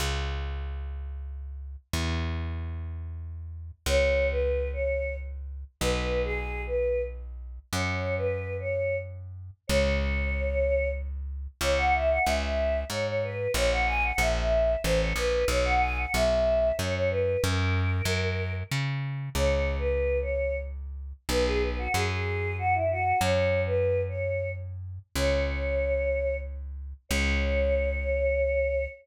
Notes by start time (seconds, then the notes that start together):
0.00 C#2
1.93 E2
3.86 C#2 C#5
4.30 B4
4.73 C#5
5.81 B1 B4
6.24 G#4
6.67 B4
7.73 F#2 C#5
8.17 B4
8.60 C#5
9.67 C#2 C#5
11.61 C#2 C#5
11.77 F#5
11.94 E5
12.10 F#5
12.25 C#2 E5
12.90 G#2 C#5
13.06 C#5
13.23 B4
13.54 A#1 C#5
13.71 F#5
13.87 G#5
14.03 F#5
14.18 A#1 E5
14.84 A1 C5
15.00 C#5
15.16 A#1 B4
15.48 B1 C#5
15.65 F#5
15.80 G#5
15.97 F#5
16.14 B1 E5
16.77 F#2 C#5
16.94 C#5
17.10 B4
17.42 F#2 A#4
18.05 F#2
18.72 C#3
19.35 C#2 C#5
19.79 B4
20.22 C#5
21.29 B1 B4
21.45 G#4
21.61 B4
21.78 F#4
21.94 F#2 G#4
22.58 F#4
22.75 E4
22.91 F#4
23.21 F#2 C#5
23.66 B4
24.09 C#5
25.15 C#2 C#5
27.09 C#2 C#5